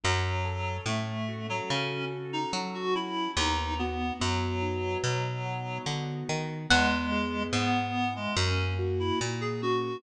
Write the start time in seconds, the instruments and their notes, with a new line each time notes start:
0.03 electric bass (finger) F#2, clarinet F#3, acoustic grand piano C#4
0.45 acoustic grand piano A4
0.86 electric bass (finger) A2, clarinet A3, acoustic grand piano C#4
1.28 acoustic grand piano F#4
1.49 clarinet F#3
1.70 electric bass (finger) C#3, clarinet C#4, acoustic grand piano C#4
2.12 acoustic grand piano A4
2.33 clarinet D#4
2.52 electric bass (finger) F#3, acoustic grand piano F#4
2.74 clarinet F#4
2.95 acoustic grand piano C#4, clarinet E4
3.37 electric bass (finger) D#2, acoustic grand piano B3, clarinet D#4
3.79 clarinet B3, acoustic grand piano F#4
4.19 electric bass (finger) F#2, clarinet F#3, acoustic grand piano B3
4.62 acoustic grand piano D#4
5.03 electric bass (finger) B2, clarinet F#3, acoustic grand piano B3
5.45 acoustic grand piano F#4
5.86 electric bass (finger) D3, acoustic grand piano D#4
6.28 electric bass (finger) D#3, acoustic grand piano B3
6.70 electric bass (finger) E2, clarinet G#3, acoustic grand piano B3, harpsichord F#5
7.12 acoustic grand piano G#4
7.53 electric bass (finger) G#2, acoustic grand piano B3, clarinet B3
7.95 acoustic grand piano E4
8.16 clarinet G#3
8.36 electric bass (finger) F#2, acoustic grand piano A#3, clarinet C#4
8.78 acoustic grand piano F#4
8.99 clarinet E4
9.21 electric bass (finger) A#2, acoustic grand piano A#3
9.41 clarinet G#4
9.62 acoustic grand piano C#4, clarinet F#4